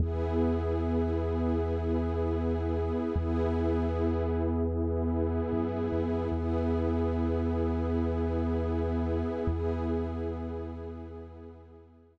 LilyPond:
<<
  \new Staff \with { instrumentName = "Pad 5 (bowed)" } { \time 6/8 \key e \mixolydian \tempo 4. = 76 <b e' gis'>2.~ | <b e' gis'>2. | <b e' gis'>2.~ | <b e' gis'>2. |
<b e' gis'>2.~ | <b e' gis'>2. | <b e' gis'>2.~ | <b e' gis'>2. | }
  \new Staff \with { instrumentName = "Synth Bass 2" } { \clef bass \time 6/8 \key e \mixolydian e,2.~ | e,2. | e,2.~ | e,4. fis,8. f,8. |
e,2.~ | e,2. | e,2.~ | e,2. | }
>>